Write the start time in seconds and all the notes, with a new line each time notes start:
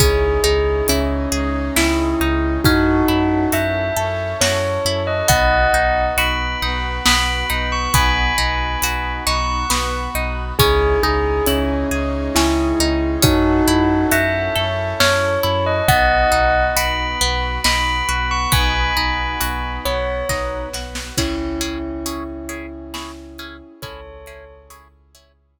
0.00 C#2 C#4 D#4 E4 G#4, kick, closed hi-hat
0.44 C#2 D#4 G#4
0.88 C#2 C#4 E4, closed hi-hat
1.31 C#2 G#3 C#4 D#4 G#4
1.76 C#2 E4, snare
2.20 C#2 D#4
2.64 F#2 C#4 D#4 E4 F#4 A4, kick, closed hi-hat
3.08 F#2 E4
3.52 F#2 F#4 E5, closed hi-hat
3.97 F#2 C#4 E4 A4 C#5
4.41 F#2 F#4 C#5, snare
4.85 F#2 E4
5.07 D#5
5.28 B1 B3 D#4 F#4 D#5 F#5, kick, closed hi-hat
5.74 B1 D#4
6.17 B1 F#4 B5, closed hi-hat
6.62 B1 B3 D#4 F#4 B4
7.06 B1 B3 B5, snare
7.50 B1 D#4
7.72 C#6
7.93 B1 B3 D#4 F#4 G#5 B5, kick, closed hi-hat
8.38 B1 D#4
8.82 B1 F#4, closed hi-hat
9.26 B1 B3 D#4 F#4 B4 C#6
9.70 B1 B3, snare
10.15 B1 D#4
10.58 C#2 C#4 D#4 E4 G#4, kick, closed hi-hat
11.03 C#2 D#4 G#4
11.47 C#2 C#4 E4, closed hi-hat
11.91 C#2 G#3 C#4 D#4 G#4
12.35 C#2 C#4 E4, snare
12.79 C#2 D#4
13.22 F#2 C#4 D#4 E4 F#4 A4, kick, closed hi-hat
13.67 F#2 E4
14.11 F#2 F#4 E5, closed hi-hat
14.55 F#2 C#4 E4 A4 C#5
15.00 F#2 C#4 C#5, snare
15.43 F#2 E4
15.66 D#5
15.88 B1 B3 D#4 F#4 D#5 F#5, kick, closed hi-hat
16.32 B1 D#4
16.76 B1 F#4 B5, closed hi-hat
17.21 B1 B3 F#4 B4
17.64 B1 D#4 B5, snare
18.09 B1 F#4
18.31 C#6
18.52 B1 B3 D#4 F#4 G#5 B5, kick, closed hi-hat
18.97 B1 D#4
19.40 B1 F#4, closed hi-hat
19.85 B1 B3 F#4 B4 C#5
20.29 B1 D#4, kick, snare
20.73 B1 F#4, snare
20.95 snare
21.17 C#2 C#4 E4 G#4, kick, crash
21.61 C#4 E4 G#4, closed hi-hat
22.06 C#4 E4 G#4, closed hi-hat
22.49 C#4 E4 G#4, closed hi-hat
22.94 C#4 E4 G#4, snare
23.38 C#4 E4 G#4, closed hi-hat
23.82 C#2 C#4 E4 G#4 A4 C#5, kick, closed hi-hat
24.26 C#4 E4 G#4, closed hi-hat
24.70 C#4 E4 G#4, closed hi-hat
25.15 C#4 E4 G#4, closed hi-hat